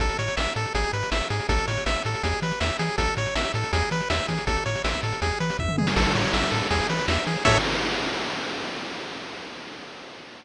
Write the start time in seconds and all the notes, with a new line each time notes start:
0.00 A1 A4, kick, closed hi-hat
0.09 closed hi-hat
0.19 A2 C#5, closed hi-hat
0.28 closed hi-hat
0.37 A1 E5, snare
0.47 closed hi-hat
0.56 A2 A4, closed hi-hat
0.65 closed hi-hat
0.75 G#1 G#4, kick, closed hi-hat
0.84 closed hi-hat
0.93 G#2 B4, closed hi-hat
1.03 closed hi-hat
1.11 G#1 E5, snare
1.21 closed hi-hat
1.30 G#2 G#4, closed hi-hat
1.40 closed hi-hat
1.49 A1 A4, kick, closed hi-hat
1.58 closed hi-hat
1.67 A2 C#5, closed hi-hat
1.77 closed hi-hat
1.86 A1 E5, snare
1.96 closed hi-hat
2.05 A2 A4, closed hi-hat
2.14 closed hi-hat
2.23 E2 G#4, kick, closed hi-hat
2.33 closed hi-hat
2.42 E3 B4, closed hi-hat
2.51 closed hi-hat
2.60 E2 E5, snare
2.70 closed hi-hat
2.79 E3 G#4, closed hi-hat
2.89 closed hi-hat
2.98 A1 A4, kick, closed hi-hat
3.08 closed hi-hat
3.17 A2 C#5, closed hi-hat
3.26 closed hi-hat
3.35 A1 E5, snare
3.45 closed hi-hat
3.54 A2 A4, closed hi-hat
3.64 closed hi-hat
3.73 E2 G#4, kick, closed hi-hat
3.82 closed hi-hat
3.91 E3 B4, closed hi-hat
4.01 closed hi-hat
4.10 E2 E5, snare
4.19 closed hi-hat
4.28 E3 G#4, kick, closed hi-hat
4.38 closed hi-hat
4.47 A1 A4, kick, closed hi-hat
4.57 closed hi-hat
4.66 A2 C#5, closed hi-hat
4.75 closed hi-hat
4.84 A1 E5, snare
4.94 kick, closed hi-hat
5.03 A2 A4, closed hi-hat
5.12 closed hi-hat
5.22 E2 G#4, kick, closed hi-hat
5.31 closed hi-hat
5.40 E3 B4, closed hi-hat
5.50 closed hi-hat
5.59 E2 E5, kick, floor tom
5.69 mid tom
5.78 E3 G#4, high tom
5.87 snare
5.96 A1 A4, kick, crash
6.05 closed hi-hat
6.15 A2 C#5, closed hi-hat
6.24 closed hi-hat
6.33 A1 E5, snare
6.43 closed hi-hat
6.51 A2 A4, closed hi-hat
6.62 closed hi-hat
6.70 E2 G#4, kick, closed hi-hat
6.80 closed hi-hat
6.89 E3 B4, closed hi-hat
6.99 closed hi-hat
7.08 E2 E5, snare
7.17 closed hi-hat
7.27 E3 G#4, closed hi-hat
7.36 closed hi-hat
7.45 A2 A4 C#5 E5, kick, crash